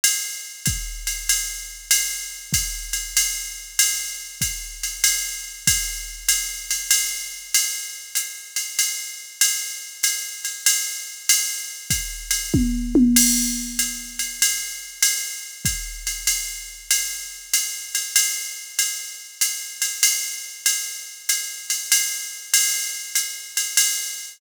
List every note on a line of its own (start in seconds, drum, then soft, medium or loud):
0.04 ride loud
0.66 kick medium
0.66 hi-hat pedal medium
0.66 ride medium
1.07 ride medium
1.29 ride loud
1.91 ride loud
2.53 kick medium
2.53 hi-hat pedal medium
2.53 ride medium
2.93 ride medium
3.17 ride loud
3.79 ride loud
4.41 kick medium
4.41 hi-hat pedal medium
4.41 ride medium
4.83 ride medium
5.04 ride loud
5.67 kick medium
5.67 ride loud
6.29 hi-hat pedal medium
6.29 ride loud
6.71 ride medium
6.91 ride loud
7.54 ride loud
8.15 hi-hat pedal loud
8.15 ride medium
8.56 ride medium
8.79 ride loud
9.41 ride loud
10.03 hi-hat pedal medium
10.03 ride loud
10.45 ride medium
10.66 ride loud
11.29 ride loud
11.90 kick medium
11.90 hi-hat pedal medium
11.90 ride medium
12.31 ride medium
12.54 kick medium
12.54 high tom medium
12.95 high tom loud
13.16 crash loud
13.16 ride loud
13.79 hi-hat pedal medium
13.79 ride medium
14.19 ride medium
14.42 ride loud
15.02 ride loud
15.65 kick medium
15.65 hi-hat pedal medium
15.65 ride medium
16.07 ride medium
16.27 ride loud
16.91 ride loud
17.54 hi-hat pedal medium
17.54 ride loud
17.95 ride medium
18.16 ride loud
18.79 ride loud
19.41 hi-hat pedal loud
19.41 ride medium
19.82 ride medium
20.03 ride loud
20.66 ride loud
21.29 hi-hat pedal medium
21.29 ride medium
21.70 ride medium
21.92 ride loud
22.54 ride loud
23.15 hi-hat pedal loud
23.15 ride medium
23.57 ride medium
23.77 ride loud